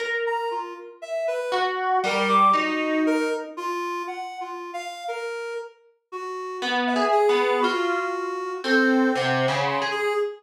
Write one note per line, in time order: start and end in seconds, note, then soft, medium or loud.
0.00 1.37 A#4 medium
0.26 0.49 A#5 medium
0.51 0.74 F4 medium
1.02 1.25 E5 medium
1.27 1.50 B4 medium
1.52 1.98 F#4 loud
2.04 2.50 G3 loud
2.04 2.28 A#4 loud
2.29 2.51 D6 loud
2.53 3.45 D#4 loud
2.53 3.02 F#4 medium
3.06 3.29 A#4 loud
3.57 4.03 F4 loud
4.07 4.38 F#5 medium
4.41 4.71 F4 medium
4.74 5.04 F5 medium
5.08 5.54 A#4 medium
6.12 6.58 F#4 medium
6.62 6.93 B3 loud
6.87 7.10 E5 medium
6.96 7.26 G#4 medium
7.12 7.58 G#4 loud
7.29 7.60 B3 medium
7.61 8.56 F4 medium
7.61 8.53 F#4 loud
8.64 9.10 C4 loud
8.64 9.10 A4 medium
9.15 9.46 C3 medium
9.15 9.62 F#5 medium
9.48 9.79 C#3 medium
9.67 9.89 C6 medium
9.82 10.12 G#4 medium
9.91 10.14 G#4 loud